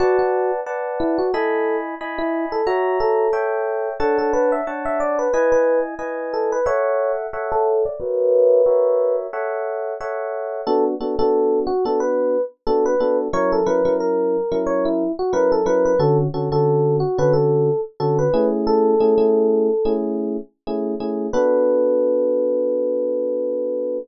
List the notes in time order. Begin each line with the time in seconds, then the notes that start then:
0.00 F#4 B4 D5 F#5 A5
0.19 F#4
0.66 B4 D5 F#5 A5
1.00 E4
1.18 F#4
1.34 E4 A4 D#5 G#5 B5
2.01 E4 D#5 G#5 B5
2.18 E4
2.52 A4
2.67 F#4 C#5 E5 A#5
3.00 A4
3.33 A4 C#5 E5 G5
4.00 D4 A4 C#5 F#5 A5
4.18 A4
4.33 B4
4.52 E5
4.67 D4 C#5 F#5 A5
4.85 E5
5.00 D5
5.19 B4
5.33 E4 B4 D#5 G#5
5.52 B4
5.99 E4 B4 D#5 G#5
6.33 A4
6.52 B4
6.66 A4 C#5 E5 F#5
7.33 A4 C#5 E5 F#5
7.52 A4
7.85 D5
8.00 F#4 A#4 B4 C#5 E5
8.66 F#4 A#4 C#5 E5
9.33 A4 C#5 E5 F#5
10.01 A4 C#5 E5 F#5
10.67 B3 D4 F#4 A4
11.01 B3 D4 F#4 A4
11.19 B3 D4 F#4 A4
11.67 F#4
11.85 B3 D4 F#4 A4
12.00 B4
12.67 B3 D4 F#4 A4
12.86 B4
13.00 B3 D4 F#4 A4
13.33 F#3 C#4 E4 A#4 C#5
13.52 A4
13.66 F#3 C#4 E4 A#4 B4
13.85 F#3 C#4 E4 A#4
14.00 A#4
14.52 F#3 C#4 E4 A#4
14.67 C#5
14.85 E4
15.19 F#4
15.33 F#3 C#4 E4 A#4 B4
15.52 A4
15.66 F#3 C#4 E4 A#4 B4
15.85 B4
15.99 D3 C#4 F#4 A4
16.34 D3 C#4 F#4 A4
16.52 D3 C#4 F#4 A4
17.00 F#4
17.18 D3 C#4 F#4 A4 B4
17.33 A4
18.00 D3 C#4 F#4 A4
18.19 B4
18.34 A3 C#4 E4 G#4
18.67 A4
19.00 A3 C#4 E4 G#4
19.18 A3 C#4 E4 G#4
19.85 A3 C#4 E4 G#4
20.67 A3 C#4 E4 G#4
21.00 A3 C#4 E4 G#4
21.33 B3 D4 F#4 A4 B4